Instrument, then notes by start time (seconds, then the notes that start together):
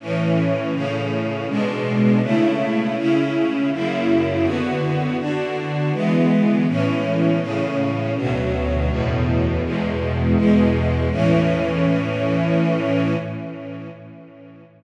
string ensemble 1
0.00 A2 E3 C#4
0.73 A2 C#3 C#4
1.48 B2 G#3 D4
2.22 C#3 A3 E4
2.96 C#3 C#4 E4
3.72 F#2 C#3 A#3 E4
4.43 D3 B3 F#4
5.18 D3 D4 F#4
5.93 E3 G#3 B3
6.67 A2 E3 C#4
7.40 A2 C#3 C#4
8.16 D2 B2 F#3
8.88 E2 A2 B2
9.63 E2 B2 G#3
10.36 E2 B2 G#3
11.11 A2 E3 C#4